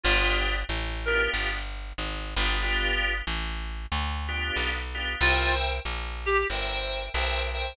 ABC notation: X:1
M:4/4
L:1/8
Q:"Swing" 1/4=93
K:G
V:1 name="Clarinet"
=F z2 _B z4 | z8 | =F z2 G z4 |]
V:2 name="Drawbar Organ"
[B,D=FG]3 [B,DFG]4 [B,DFG] | [B,D=FG]5 [B,DFG]2 [B,DFG] | [_Bceg]4 [Bceg]2 [Bceg] [Bceg] |]
V:3 name="Electric Bass (finger)" clef=bass
G,,,2 A,,,2 G,,,2 ^G,,, =G,,,- | G,,,2 A,,,2 D,,2 B,,,2 | C,,2 _B,,,2 G,,,2 =B,,,2 |]